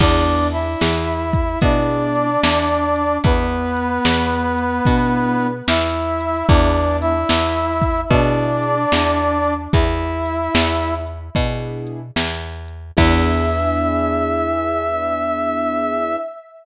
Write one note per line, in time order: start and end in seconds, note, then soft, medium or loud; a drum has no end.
0.00 0.76 E2 medium
0.00 0.64 B3 medium
0.00 0.48 D4 medium
0.00 0.64 D4 medium
0.00 0.64 E4 medium
0.00 0.64 G#4 medium
0.00 0.48 D5 medium
0.00 kick loud
0.00 crash loud
0.52 1.59 E4 medium
0.52 1.59 E5 medium
0.52 closed hi-hat medium
0.81 1.57 E2 medium
0.81 snare loud
1.33 kick loud
1.33 closed hi-hat medium
1.61 2.37 B2 medium
1.61 2.27 B3 medium
1.61 3.17 D4 medium
1.61 2.27 D4 medium
1.61 2.27 E4 medium
1.61 2.27 G#4 medium
1.61 3.17 D5 medium
1.61 kick loud
1.61 closed hi-hat loud
2.15 closed hi-hat medium
2.43 3.19 E2 medium
2.43 snare loud
2.96 closed hi-hat medium
3.24 3.99 E2 medium
3.24 5.47 B3 medium
3.24 5.47 B4 medium
3.24 kick loud
3.24 closed hi-hat loud
3.77 closed hi-hat medium
4.05 4.81 E2 medium
4.05 snare loud
4.58 closed hi-hat medium
4.85 5.62 B2 medium
4.85 5.50 B3 medium
4.85 5.50 D4 medium
4.85 5.50 E4 medium
4.85 5.50 G#4 medium
4.85 kick loud
4.85 closed hi-hat loud
5.40 closed hi-hat medium
5.68 6.43 E2 medium
5.68 6.46 E4 medium
5.68 6.46 E5 medium
5.68 snare loud
6.21 closed hi-hat medium
6.48 7.24 E2 medium
6.48 7.13 B3 medium
6.48 7.13 D4 medium
6.48 6.97 D4 medium
6.48 7.13 E4 medium
6.48 7.13 G#4 medium
6.48 6.97 D5 medium
6.48 kick loud
6.48 closed hi-hat loud
7.01 8.00 E4 medium
7.01 8.00 E5 medium
7.01 closed hi-hat medium
7.29 8.05 E2 medium
7.29 snare loud
7.82 kick loud
7.82 closed hi-hat medium
8.10 8.86 B2 medium
8.10 8.75 B3 medium
8.10 8.75 D4 medium
8.10 9.54 D4 medium
8.10 8.75 E4 medium
8.10 8.75 G#4 medium
8.10 9.54 D5 medium
8.10 kick loud
8.10 closed hi-hat loud
8.63 closed hi-hat medium
8.92 9.68 E2 medium
8.92 snare loud
9.44 closed hi-hat medium
9.73 10.49 E2 medium
9.73 10.94 E4 medium
9.73 10.94 E5 medium
9.73 kick loud
9.73 closed hi-hat loud
10.26 closed hi-hat medium
10.55 11.30 E2 medium
10.55 snare loud
11.07 closed hi-hat medium
11.35 12.11 B2 medium
11.35 11.99 B3 medium
11.35 11.99 D4 medium
11.35 11.99 E4 medium
11.35 11.99 G#4 medium
11.35 kick loud
11.35 closed hi-hat loud
11.87 closed hi-hat medium
12.16 12.92 E2 medium
12.16 snare loud
12.68 closed hi-hat medium
12.97 16.17 E2 loud
12.97 16.16 B3 loud
12.97 16.16 D4 loud
12.97 16.16 E4 loud
12.97 16.16 G#4 loud
12.97 16.16 E5 loud
12.97 kick loud
12.97 crash loud